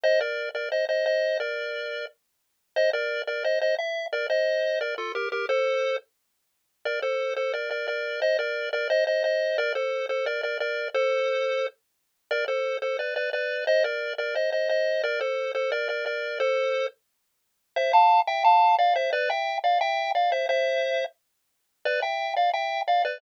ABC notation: X:1
M:4/4
L:1/8
Q:1/4=176
K:Bb
V:1 name="Lead 1 (square)"
[ce] [Bd]2 [Bd] [ce] [ce] [ce]2 | [Bd]4 z4 | [ce] [Bd]2 [Bd] [ce] [ce] =e2 | [Bd] [ce]3 [Bd] [FA] [GB] [GB] |
[Ac]3 z5 | [Bd] [Ac]2 [Ac] [Bd] [Bd] [Bd]2 | [ce] [Bd]2 [Bd] [ce] [ce] [ce]2 | [Bd] [Ac]2 [Ac] [Bd] [Bd] [Bd]2 |
[Ac]5 z3 | [Bd] [Ac]2 [Ac] [=Bd] [Bd] [Bd]2 | [ce] [Bd]2 [Bd] [ce] [ce] [ce]2 | [Bd] [Ac]2 [Ac] [Bd] [Bd] [Bd]2 |
[Ac]3 z5 | [K:C] [ce] [fa]2 [eg] [fa]2 [df] [ce] | [Bd] [eg]2 [df] [eg]2 [df] [ce] | [ce]4 z4 |
[Bd] [eg]2 [df] [eg]2 [df] [Bd] |]